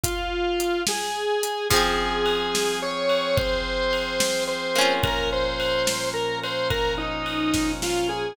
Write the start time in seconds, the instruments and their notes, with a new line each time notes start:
0.03 drawbar organ F4, kick, closed hi-hat
0.60 closed hi-hat
0.87 drawbar organ G#4, snare
1.43 closed hi-hat
1.70 drawbar organ F3 C4 G#4, orchestral harp F3 C4, kick, crash
1.76 orchestral harp G#4
2.26 ride
2.55 snare
2.82 drawbar organ C#5
3.09 ride
3.36 drawbar organ C5, kick, ride
3.93 ride
4.20 snare
4.47 drawbar organ C5
4.75 orchestral harp A#3 C#4, ride
4.81 orchestral harp F4
5.02 drawbar organ A#2 F3 C#4 A#4, kick, ride
5.33 drawbar organ C5
5.60 ride
5.87 snare
6.14 drawbar organ A#4
6.44 drawbar organ C5, ride
6.70 drawbar organ A#4, kick, ride
6.98 drawbar organ D#4
7.26 ride
7.54 kick, snare
7.82 drawbar organ F4, snare
8.09 drawbar organ G#4